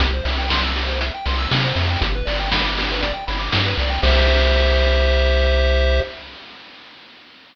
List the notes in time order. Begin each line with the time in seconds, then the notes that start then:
0.00 C2 G4, kick, closed hi-hat
0.13 C5
0.24 C2 E5, open hi-hat
0.38 G5
0.49 C6, kick, snare
0.64 E6
0.76 G4, open hi-hat
0.87 C5
1.01 E5, closed hi-hat
1.14 G5
1.26 C2 C6, open hi-hat
1.38 E6
1.51 C3 G4, kick, snare
1.64 C5
1.76 F2 E5, open hi-hat
1.90 G5
2.01 G1 G4, kick, closed hi-hat
2.15 B4
2.26 G1 D5, open hi-hat
2.39 G5
2.51 B5, kick, snare
2.64 D6
2.77 G4, open hi-hat
2.91 B4
3.01 D5, kick, closed hi-hat
3.14 G5
3.27 G1 B5, open hi-hat
3.39 D6
3.52 G2 G4, kick, snare
3.66 B4
3.78 C2 D5, open hi-hat
3.90 G5
4.03 C2 G4 C5 E5, kick, crash